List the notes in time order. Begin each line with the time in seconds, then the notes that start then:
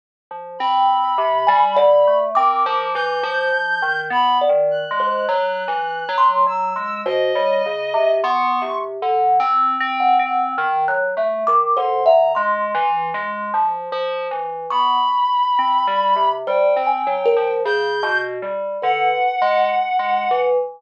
0.31 F3
0.59 C4 B5
1.18 C3
1.47 G3 G#5
1.76 D3 D5
2.07 A3
2.35 C4 A#4 D6
2.66 F3
2.94 E3 G6
3.23 F3
3.53 F3
3.82 D#3
4.10 B3 B5
4.41 D5
4.49 D#3
4.71 F#6
4.91 G#3
5.00 C5
5.28 F#3
5.68 E3
6.09 F#3
6.18 C6
6.47 F#3 E6
6.76 G#3
7.06 B2 C5 D#5
7.35 G3 C#5
7.66 C#3
7.94 C3
8.23 B3 C6 C#6
8.62 C3
9.02 D3
9.40 C4
9.80 C4
10.00 F#5
10.19 C4
10.58 D#3
10.88 F#3 F#6
11.17 A3 E5
11.47 D#3 D6
11.76 D3 C5 C6
12.06 D3 E5 A#5
12.35 G#3 C6
12.75 E3
13.14 G#3
13.54 F3
13.92 F3
14.31 E3
14.70 B3 B5 C#6
15.59 C4
15.87 G3
16.16 C3
16.47 G3 C5 G5
16.76 C4
16.87 G#5
17.07 F#3
17.25 A#4
17.37 F3
17.65 C#3 G6
18.03 B2
18.42 G3
18.82 D3 B4 F#5
19.42 G#3
19.99 G#3
20.31 E3